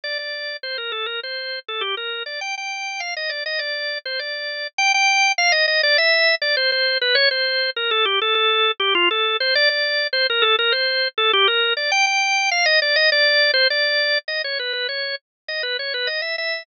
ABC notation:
X:1
M:4/4
L:1/16
Q:1/4=101
K:Gm
V:1 name="Drawbar Organ"
d d3 c B A B c3 A G B2 d | g g3 f e d e d3 c d4 | g g3 f e e d =e3 d c c2 =B | ^c =c3 B A G A A3 G F A2 c |
d d3 c B A B c3 A G B2 d | g g3 f e d e d3 c d4 | [K:G#m] d c B B c2 z2 d B c B d e e2 |]